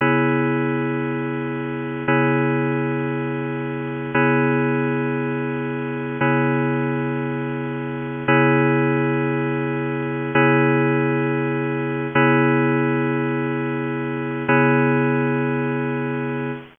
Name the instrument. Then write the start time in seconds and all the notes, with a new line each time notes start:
electric piano 2
0.01 C#3 B3 E4 G#4
2.08 C#3 B3 E4 G#4
4.14 C#3 B3 E4 G#4
6.21 C#3 B3 E4 G#4
8.28 C#3 B3 E4 G#4
10.35 C#3 B3 E4 G#4
12.15 C#3 B3 E4 G#4
14.48 C#3 B3 E4 G#4